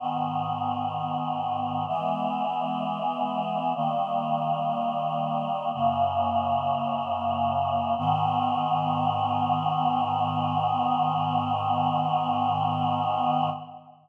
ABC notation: X:1
M:4/4
L:1/8
Q:1/4=64
K:G#m
V:1 name="Choir Aahs"
[G,,D,B,]4 [E,G,B,]4 | "^rit." [D,=G,A,]4 [F,,C,A,]4 | [G,,D,B,]8 |]